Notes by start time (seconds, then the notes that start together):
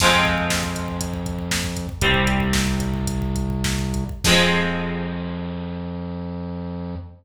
0.00 F2 F3 G#3 C4, kick, crash
0.13 kick
0.25 kick
0.38 kick
0.50 kick, snare, closed hi-hat
0.63 kick
0.75 kick, closed hi-hat
0.88 kick
1.01 kick, closed hi-hat
1.14 kick
1.26 kick, closed hi-hat
1.39 kick
1.51 kick, snare
1.64 kick
1.77 kick, closed hi-hat
1.89 kick
2.01 C2 G3 C4, kick, closed hi-hat
2.14 kick
2.27 kick, closed hi-hat
2.40 kick
2.53 kick, snare
2.67 kick
2.80 kick, closed hi-hat
2.94 kick
3.07 kick, closed hi-hat
3.22 kick
3.36 kick, closed hi-hat
3.50 kick
3.64 kick, snare
3.79 kick
3.94 kick, closed hi-hat
4.09 kick
4.24 F2 F3 G#3 C4, kick, crash